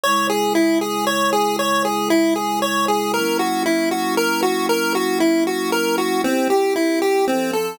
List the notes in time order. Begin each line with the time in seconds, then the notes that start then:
0.03 C#3 G#3 E4 C#5
0.30 G#4
0.55 E4
0.81 G#4
1.07 C#5
1.33 G#4
1.59 C#5
1.85 G#4
2.10 E4
2.36 G#4
2.62 C#5
2.88 G#4
3.13 F#3 A#3 C#4 E4 A#4
3.39 F#4
3.66 E4
3.91 F#4
4.17 A#4
4.43 F#4
4.69 A#4
4.95 F#4
5.20 E4
5.47 F#4
5.72 A#4
5.98 F#4
6.24 C4 E4 G4
6.50 G4
6.76 E4
7.02 G4
7.27 F3 C4 A4
7.53 A4